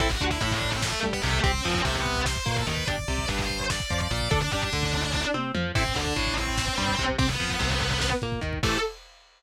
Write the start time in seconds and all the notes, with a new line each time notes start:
0.00 A1 C4 E4 A4 E5, kick, crash
0.10 F#4 F#5, kick
0.20 D2 D3, kick, closed hi-hat
0.31 E4 E5, kick
0.41 A1 A2 E4 E5, kick, closed hi-hat
0.51 D4 D5, kick
0.61 kick, closed hi-hat
0.72 C4 C5, kick
0.82 A3 A4, kick, snare
0.93 kick
1.03 G2 G3, kick, closed hi-hat
1.13 B3 B4, kick
1.22 C2 C3 A3 A4, kick, closed hi-hat
1.33 kick
1.44 C2 C4 G4 C5, kick, closed hi-hat
1.54 kick
1.64 F2 F3, kick, closed hi-hat
1.75 kick
1.85 C2 C3 A3 A4, kick, closed hi-hat
1.95 B3 B4, kick
2.05 kick, closed hi-hat
2.16 kick
2.26 C5 C6, kick, snare
2.36 kick
2.46 A#2 A#3, kick, closed hi-hat
2.56 A4 A5, kick
2.67 D#2 D#3 B4 B5, kick, closed hi-hat
2.77 kick
2.88 G1 D4 G4 D5 D6, kick, closed hi-hat
2.98 kick
3.08 C2 C3, kick, closed hi-hat
3.18 kick
3.28 G1 G2 B4 B5, kick, closed hi-hat
3.38 C5 C6, kick
3.49 kick, closed hi-hat
3.60 kick
3.70 D5 D6, kick, snare
3.80 kick
3.90 F2 F3, kick, closed hi-hat
4.00 D5 D6, kick
4.11 A#1 A#2 D5 D6, kick, closed hi-hat
4.21 kick
4.31 D2 D4 A4 D5, kick, closed hi-hat
4.41 D4 D5, kick
4.52 G2 G3 D4 D5, kick, closed hi-hat
4.62 D4 D5, kick
4.73 D2 D3, kick, closed hi-hat
4.83 kick
4.93 kick, closed hi-hat
5.04 kick
5.14 kick, snare
5.34 C3 C4, high tom
5.55 F2 F3, mid tom
5.75 A1 C4 E4 A4 C5, kick, crash
5.86 kick
5.96 D2 D3 D4 D5, kick, closed hi-hat
6.06 kick
6.16 A1 A2, kick, closed hi-hat
6.27 kick
6.37 C4 C5, kick, closed hi-hat
6.47 kick
6.58 kick, snare
6.68 kick
6.78 G2 G3, kick, closed hi-hat
6.88 kick
6.99 C2 C3, kick, closed hi-hat
7.09 kick
7.18 C2 C4 G4 C5, kick, closed hi-hat
7.29 B3 B4, kick
7.40 F2 F3, kick, closed hi-hat
7.50 kick
7.59 C2 C3, kick, closed hi-hat
7.71 kick
7.81 kick, closed hi-hat
7.91 kick
8.01 kick, snare
8.12 kick
8.22 A#2 A#3, kick, closed hi-hat
8.32 kick
8.41 D#2 D#3, kick, closed hi-hat
8.53 kick
8.63 A2 C3 E3 A3 A4, kick, crash